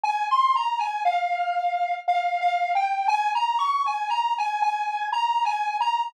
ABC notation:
X:1
M:3/4
L:1/16
Q:1/4=59
K:Ab
V:1 name="Lead 1 (square)"
a c' b a f4 (3f2 f2 g2 | a b d' a b a a2 (3b2 a2 b2 |]